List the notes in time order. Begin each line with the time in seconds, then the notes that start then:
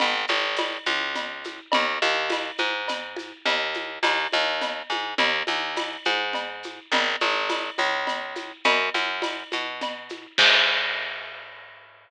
0.00 G#1, cowbell, low conga, shaker
0.27 G#1, high conga, shaker
0.56 tambourine, cowbell, high conga, shaker
0.86 C#2, high conga, shaker
1.15 cowbell, low conga, shaker
1.44 high conga, shaker
1.72 D#2, cowbell, low conga, shaker
2.02 D#2, high conga, shaker
2.30 tambourine, cowbell, high conga, shaker
2.58 G#2, high conga, shaker
2.88 cowbell, low conga, shaker
3.16 high conga, shaker
3.46 D#2, cowbell, low conga, shaker
3.74 high conga, shaker
4.03 D#2, tambourine, cowbell, high conga, shaker
4.32 D#2, high conga, shaker
4.61 cowbell, low conga, shaker
4.90 G#2, high conga, shaker
5.18 D#2, cowbell, low conga, shaker
5.47 D#2, high conga, shaker
5.76 tambourine, cowbell, high conga, shaker
6.05 G#2, high conga, shaker
6.33 cowbell, low conga, shaker
6.63 high conga, shaker
6.92 G#1, cowbell, low conga, shaker
7.20 G#1, high conga, shaker
7.50 tambourine, cowbell, high conga, shaker
7.78 C#2, high conga, shaker
8.07 cowbell, low conga, shaker
8.35 high conga, shaker
8.64 F#2, cowbell, low conga, shaker
8.94 F#2, high conga, shaker
9.22 tambourine, cowbell, high conga, shaker
9.52 B2, high conga, shaker
9.81 cowbell, low conga, shaker
10.09 high conga, shaker
10.38 G#2, kick, crash